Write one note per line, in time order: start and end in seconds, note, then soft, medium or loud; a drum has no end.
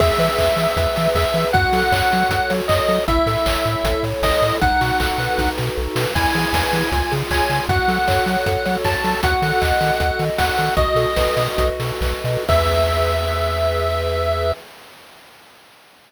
0.00 0.11 E2 medium
0.00 0.57 G#4 medium
0.00 1.09 E5 medium
0.00 kick loud
0.00 crash loud
0.18 0.29 E3 medium
0.18 0.76 B4 medium
0.18 open hi-hat medium
0.38 0.49 E2 medium
0.38 0.96 E5 medium
0.38 kick medium
0.38 clap loud
0.57 0.67 E3 medium
0.57 1.15 G#4 medium
0.57 open hi-hat medium
0.77 0.87 E2 medium
0.77 1.34 B4 medium
0.77 kick medium
0.77 closed hi-hat loud
0.96 1.08 E3 medium
0.96 1.51 E5 medium
0.96 open hi-hat medium
1.15 1.25 E2 medium
1.15 1.52 G#4 medium
1.15 1.47 E5 medium
1.15 kick medium
1.15 clap loud
1.34 1.45 E3 medium
1.34 1.53 B4 medium
1.34 open hi-hat medium
1.53 1.65 F#2 loud
1.53 2.11 F#4 loud
1.53 2.52 F#5 loud
1.53 kick loud
1.53 closed hi-hat medium
1.73 1.83 F#3 medium
1.73 2.30 A4 medium
1.73 open hi-hat medium
1.92 2.02 F#2 medium
1.92 2.49 C#5 medium
1.92 kick medium
1.92 clap loud
2.12 2.24 F#3 medium
2.12 2.69 F#4 medium
2.12 open hi-hat medium
2.29 2.40 F#2 medium
2.29 2.88 A4 medium
2.29 kick medium
2.29 closed hi-hat loud
2.50 2.61 F#3 medium
2.50 3.05 C#5 medium
2.50 open hi-hat medium
2.68 2.80 F#2 medium
2.68 3.06 F#4 medium
2.68 3.03 D#5 medium
2.68 kick medium
2.68 clap loud
2.89 2.99 F#3 medium
2.89 3.07 A4 medium
2.89 open hi-hat medium
3.08 3.19 A1 medium
3.08 3.65 E4 medium
3.08 4.03 E5 medium
3.08 kick loud
3.08 closed hi-hat loud
3.26 3.37 A2 medium
3.26 3.84 A4 medium
3.26 open hi-hat medium
3.46 3.57 A1 medium
3.46 4.04 C#5 medium
3.46 kick medium
3.46 clap loud
3.65 3.76 A2 medium
3.65 4.23 E4 medium
3.65 open hi-hat medium
3.84 3.94 A1 medium
3.84 4.42 A4 medium
3.84 kick loud
3.84 closed hi-hat loud
4.03 4.14 A2 medium
4.03 4.59 C#5 medium
4.03 open hi-hat medium
4.22 4.33 A1 medium
4.22 4.60 E4 medium
4.22 4.56 D#5 loud
4.22 kick loud
4.22 snare loud
4.42 4.53 A2 medium
4.42 4.61 A4 medium
4.42 open hi-hat medium
4.61 4.73 B1 medium
4.61 5.38 D#4 medium
4.61 5.50 F#5 medium
4.61 kick loud
4.61 closed hi-hat loud
4.81 4.92 B2 medium
4.81 5.57 F#4 medium
4.81 open hi-hat medium
5.00 5.11 B1 medium
5.00 5.76 A4 medium
5.00 kick medium
5.00 clap loud
5.18 5.29 B2 medium
5.18 5.96 B4 medium
5.18 open hi-hat medium
5.38 5.49 B1 medium
5.38 6.11 D#4 medium
5.38 kick medium
5.38 snare medium
5.58 5.70 B2 medium
5.58 6.13 F#4 medium
5.58 snare medium
5.77 5.88 B1 medium
5.77 6.13 A4 medium
5.96 6.06 B2 medium
5.96 6.14 B4 medium
5.96 snare loud
6.15 6.26 E2 medium
6.15 6.73 E4 loud
6.15 7.14 G#5 medium
6.15 kick loud
6.15 crash loud
6.35 6.46 E3 medium
6.35 6.90 G#4 medium
6.35 open hi-hat medium
6.53 6.64 E2 medium
6.53 6.90 B4 medium
6.53 kick medium
6.53 snare loud
6.73 6.83 E3 medium
6.73 6.91 E4 medium
6.73 open hi-hat medium
6.92 7.02 C#2 medium
6.92 7.49 F4 loud
6.92 kick medium
6.92 closed hi-hat loud
7.12 7.23 C#3 medium
7.12 7.66 G#4 medium
7.12 open hi-hat medium
7.31 7.41 C#2 medium
7.31 7.67 C#5 medium
7.31 7.64 G#5 medium
7.31 kick medium
7.31 clap loud
7.50 7.60 C#3 medium
7.50 7.68 F4 medium
7.50 open hi-hat medium
7.69 7.79 F#2 loud
7.69 8.26 F#4 medium
7.69 8.76 F#5 medium
7.69 kick loud
7.69 closed hi-hat loud
7.88 7.99 F#3 medium
7.88 8.46 A4 medium
7.88 open hi-hat medium
8.08 8.19 F#2 medium
8.08 8.65 C#5 medium
8.08 kick medium
8.08 clap loud
8.26 8.37 F#3 medium
8.26 8.84 F#4 medium
8.26 open hi-hat medium
8.46 8.57 F#2 medium
8.46 9.04 A4 medium
8.46 kick medium
8.46 closed hi-hat loud
8.65 8.77 F#3 medium
8.65 9.20 C#5 medium
8.65 open hi-hat medium
8.84 8.96 F#2 medium
8.84 9.21 F#4 medium
8.84 9.19 A5 medium
8.84 kick medium
8.84 snare loud
9.04 9.15 F#3 medium
9.04 9.22 A4 medium
9.04 open hi-hat medium
9.23 9.34 D#2 medium
9.23 9.80 F#4 medium
9.23 10.23 F#5 medium
9.23 kick loud
9.23 closed hi-hat loud
9.42 9.53 D#3 medium
9.42 9.99 A4 medium
9.42 open hi-hat medium
9.61 9.73 D#2 medium
9.61 10.19 D#5 medium
9.61 kick medium
9.61 clap loud
9.81 9.91 D#3 medium
9.81 10.38 F#4 medium
9.81 open hi-hat medium
10.00 10.11 D#2 medium
10.00 10.57 A4 medium
10.00 kick medium
10.00 closed hi-hat loud
10.19 10.30 D#3 medium
10.19 10.74 D#5 medium
10.19 open hi-hat medium
10.38 10.50 D#2 medium
10.38 10.75 F#4 medium
10.38 10.74 F#5 medium
10.38 kick medium
10.38 snare loud
10.58 10.69 D#3 medium
10.58 10.76 A4 medium
10.58 open hi-hat medium
10.77 10.88 B1 loud
10.77 11.57 F#4 loud
10.77 11.68 D#5 medium
10.77 kick loud
10.77 closed hi-hat loud
10.95 11.06 B2 medium
10.95 11.79 A4 medium
10.95 open hi-hat medium
11.16 11.28 B1 medium
11.16 12.01 B4 medium
11.16 kick medium
11.16 snare loud
11.37 11.48 B2 medium
11.37 12.24 D#5 medium
11.37 open hi-hat medium
11.58 11.70 B1 medium
11.58 12.44 F#4 medium
11.58 kick medium
11.58 closed hi-hat loud
11.80 11.92 B2 medium
11.80 12.45 A4 medium
11.80 open hi-hat medium
12.01 12.14 B1 loud
12.01 12.46 B4 medium
12.01 kick medium
12.01 clap loud
12.24 12.37 B2 medium
12.24 12.47 D#5 medium
12.24 open hi-hat medium
12.49 14.53 E2 loud
12.49 14.52 G#4 medium
12.49 14.52 B4 loud
12.49 14.52 E5 medium
12.49 14.52 E5 loud
12.49 kick loud
12.49 crash loud